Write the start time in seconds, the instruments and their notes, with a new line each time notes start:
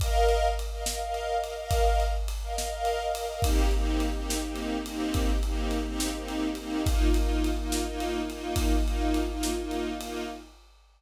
0.00 string ensemble 1 A#4 D#5 F5, kick, ride
0.29 ride
0.59 ride
0.72 string ensemble 1 A#4 D#5 F5
0.86 string ensemble 1 A#4 D#5 F5, snare
1.01 string ensemble 1 A#4 D#5 F5
1.14 ride
1.42 string ensemble 1 A#4 D#5 F5, ride
1.58 string ensemble 1 A#4 D#5 F5
1.71 kick, ride
2.00 ride
2.28 ride
2.42 string ensemble 1 A#4 D#5 F5
2.57 string ensemble 1 A#4 D#5 F5, snare
2.71 string ensemble 1 A#4 D#5 F5
2.85 ride
3.14 string ensemble 1 A#4 D#5 F5, ride
3.29 string ensemble 1 A#4 D#5 F5
3.42 string ensemble 1 A#3 C4 D#4 G4, kick, ride
3.71 string ensemble 1 A#3 C4 D#4 G4, ride
4.00 ride
4.14 string ensemble 1 A#3 C4 D#4 G4
4.30 snare
4.43 string ensemble 1 A#3 C4 D#4 G4
4.56 ride
4.85 string ensemble 1 A#3 C4 D#4 G4, ride
5.14 kick, ride
5.43 string ensemble 1 A#3 C4 D#4 G4, ride
5.71 ride
5.86 string ensemble 1 A#3 C4 D#4 G4
6.00 snare
6.14 string ensemble 1 A#3 C4 D#4 G4
6.28 ride
6.55 string ensemble 1 A#3 C4 D#4 G4, ride
6.85 string ensemble 1 A#3 D#4 F4, kick, ride
7.14 string ensemble 1 A#3 D#4 F4, ride
7.44 ride
7.57 string ensemble 1 A#3 D#4 F4
7.72 snare
7.85 string ensemble 1 A#3 D#4 F4
8.00 ride
8.29 string ensemble 1 A#3 D#4 F4, ride
8.56 kick, ride
8.85 string ensemble 1 A#3 D#4 F4, ride
9.14 ride
9.29 string ensemble 1 A#3 D#4 F4
9.43 snare
9.58 string ensemble 1 A#3 D#4 F4
9.71 ride
10.00 string ensemble 1 A#3 D#4 F4, ride